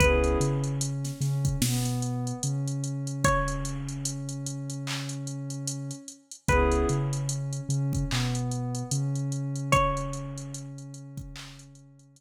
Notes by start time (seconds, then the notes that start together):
0.00 C#2 B3 C#4 E4 G#4 B4, kick, closed hi-hat
0.24 closed hi-hat
0.40 C#3 C#4, closed hi-hat
0.64 closed hi-hat
0.81 closed hi-hat
1.05 snare, closed hi-hat
1.21 C#3 C#4, snare, closed hi-hat
1.45 kick, closed hi-hat
1.62 B2 B3, snare
1.85 closed hi-hat
2.02 closed hi-hat
2.27 closed hi-hat
2.43 C#3 C#4, closed hi-hat
2.68 closed hi-hat
2.84 closed hi-hat
3.07 closed hi-hat
3.24 C#5, kick, closed hi-hat
3.48 closed hi-hat
3.65 closed hi-hat
3.89 closed hi-hat
4.05 closed hi-hat
4.29 closed hi-hat
4.46 closed hi-hat
4.70 closed hi-hat
4.87 clap
5.09 closed hi-hat
5.27 closed hi-hat
5.50 closed hi-hat
5.67 closed hi-hat
5.91 closed hi-hat
6.08 closed hi-hat
6.31 closed hi-hat
6.48 C#2 B3 C#4 E4 G#4 B4, kick, closed hi-hat
6.72 closed hi-hat
6.89 C#3 C#4, closed hi-hat
7.13 closed hi-hat
7.29 closed hi-hat
7.53 closed hi-hat
7.69 C#3 C#4, closed hi-hat
7.93 kick, closed hi-hat
8.10 B2 B3, clap
8.35 closed hi-hat
8.52 closed hi-hat
8.75 closed hi-hat
8.91 C#3 C#4, closed hi-hat
9.16 closed hi-hat
9.32 closed hi-hat
9.56 closed hi-hat
9.72 C#5, kick, closed hi-hat
9.97 closed hi-hat
10.13 closed hi-hat
10.38 closed hi-hat
10.54 closed hi-hat
10.78 closed hi-hat
10.94 closed hi-hat
11.17 kick, closed hi-hat
11.36 clap
11.59 closed hi-hat
11.75 closed hi-hat
11.99 closed hi-hat
12.16 closed hi-hat